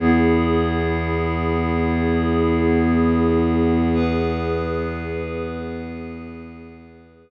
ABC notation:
X:1
M:4/4
L:1/8
Q:1/4=61
K:E
V:1 name="Pad 5 (bowed)"
[B,EG]8 | [B,GB]8 |]
V:2 name="Violin" clef=bass
E,,8- | E,,8 |]